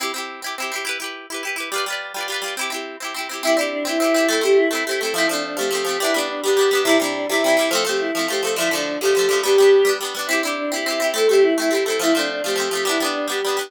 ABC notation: X:1
M:6/8
L:1/8
Q:3/8=140
K:C
V:1 name="Choir Aahs"
z6 | z6 | z6 | z6 |
E D D E3 | A G E E G A | E D D G3 | E D D G3 |
E D D E3 | A G E E G A | E D D G3 | G4 z2 |
E D D E3 | A G E E G A | E D D G3 | E D D G3 |]
V:2 name="Orchestral Harp"
[CEG] [CEG]2 [CEG] [CEG] [CEG] | [EGB] [EGB]2 [EGB] [EGB] [EGB] | [G,FBd] [G,FBd]2 [G,FBd] [G,FBd] [G,FBd] | [CEG] [CEG]2 [CEG] [CEG] [CEG] |
[CEG] [CEG]2 [CEG] [CEG] [CEG] | [A,CE] [A,CE]2 [A,CE] [A,CE] [A,CE] | [F,A,C] [F,A,C]2 [F,A,C] [F,A,C] [F,A,C] | [G,B,D] [G,B,D]2 [G,B,D] [G,B,D] [G,B,D] |
[C,G,E] [C,G,E]2 [C,G,E] [C,G,E] [C,G,E] | [F,A,C] [F,A,C]2 [F,A,C] [F,A,C] [F,A,C] | [D,F,A,] [D,F,A,]2 [D,F,A,] [D,F,A,] [D,F,A,] | [G,B,D] [G,B,D]2 [G,B,D] [G,B,D] [G,B,D] |
[CEG] [CEG]2 [CEG] [CEG] [CEG] | [A,CE] [A,CE]2 [A,CE] [A,CE] [A,CE] | [F,A,C] [F,A,C]2 [F,A,C] [F,A,C] [F,A,C] | [G,B,D] [G,B,D]2 [G,B,D] [G,B,D] [G,B,D] |]